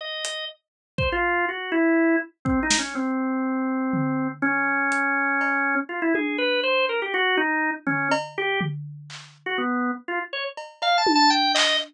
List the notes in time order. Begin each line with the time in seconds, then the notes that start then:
0.01 D#5
0.25 closed hi-hat
0.98 C5, kick
1.12 F4
1.49 F#4
1.72 E4
2.45 C4, kick
2.63 D#4
2.70 snare
2.79 C#4
2.95 C4
3.93 floor tom
4.42 C#4
4.92 closed hi-hat
5.41 cowbell
5.89 F4
6.02 E4
6.15 G#4, high tom
6.38 B4
6.63 C5
6.89 A#4
7.02 G4
7.14 F#4
7.37 D#4
7.87 C#4, floor tom
8.11 cowbell
8.38 G4
8.61 floor tom
9.10 clap
9.46 F#4
9.58 B3
10.08 F4
10.33 C#5
10.57 cowbell
10.82 F5, cowbell
10.98 A5
11.07 high tom
11.15 A5
11.30 G5
11.55 D#5, clap